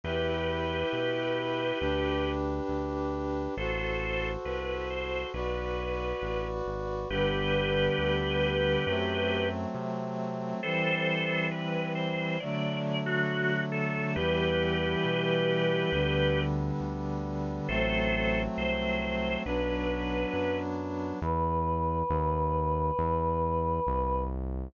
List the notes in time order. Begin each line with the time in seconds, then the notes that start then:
0.03 E2 E4 G4 B4
0.93 B2
1.80 D2 D4 G4 B4
2.68 D2
3.57 A1 F#4 A4 C5
4.45 C2 B4
4.90 C5
5.33 B1 F#4 B4 D5
6.22 A1
6.66 G#1
7.10 G1 D3 G3 B3 G4 B4
7.98 D2
8.86 F#2 F#3 A3 C4
9.74 C3
10.63 E3 G3 C4 A4 C5
11.51 B4
11.95 C5
12.40 D3 F#3 A3 D5
13.06 F#4
13.72 A4
14.15 E2 E3 G3 B3 G4 B4
15.05 B2
15.92 D2 D3 G3 B3
16.81 D2
17.68 A1 F#3 A3 C4 A4 C5
18.57 C2 C5
19.01 C5
19.44 B1 F#3 B3 D4 B4
20.33 F#2
21.22 E2 B4
22.10 D#2
22.99 E2
23.87 C2